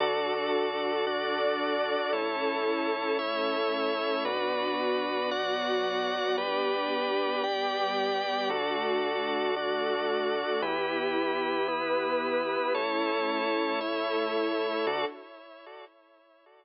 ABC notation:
X:1
M:4/4
L:1/8
Q:1/4=113
K:D
V:1 name="String Ensemble 1"
[DFA]4 [DAd]4 | [CEA]4 [A,CA]4 | [B,DF]4 [F,B,F]4 | [B,DG]4 [G,B,G]4 |
[A,DF]4 [A,FA]4 | [B,EG]4 [B,GB]4 | [A,CE]4 [A,EA]4 | [DFA]2 z6 |]
V:2 name="Drawbar Organ"
[FAd]4 [DFd]4 | [EAc]4 [Ece]4 | [FBd]4 [Fdf]4 | [GBd]4 [Gdg]4 |
[FAd]4 [DFd]4 | [EGB]4 [B,EB]4 | [EAc]4 [Ece]4 | [FAd]2 z6 |]
V:3 name="Synth Bass 1" clef=bass
D,,8 | A,,,8 | B,,,8 | G,,,8 |
D,,8 | E,,8 | A,,,8 | D,,2 z6 |]